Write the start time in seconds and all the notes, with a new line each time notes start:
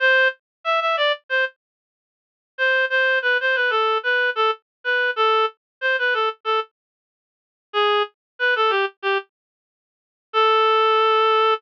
0.00 C5
0.64 E5
0.81 E5
0.97 D5
1.29 C5
2.58 C5
2.90 C5
3.22 B4
3.41 C5
3.55 B4
3.70 A4
4.03 B4
4.35 A4
4.84 B4
5.16 A4
5.81 C5
5.99 B4
6.14 A4
6.45 A4
7.73 G#4
8.39 B4
8.56 A4
8.70 G4
9.02 G4
10.33 A4